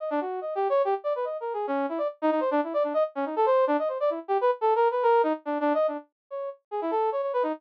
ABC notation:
X:1
M:3/4
L:1/16
Q:1/4=143
K:none
V:1 name="Brass Section"
^d =D ^F2 (3^d2 G2 ^c2 G z =d B | (3^d2 ^A2 ^G2 ^C2 E =d z ^D D =c | D E d D ^d z ^C ^D A =c2 =D | ^d c =d E z G B z (3A2 ^A2 B2 |
^A2 ^D z (3=D2 D2 ^d2 =D z3 | ^c2 z2 ^G E A2 c c B ^D |]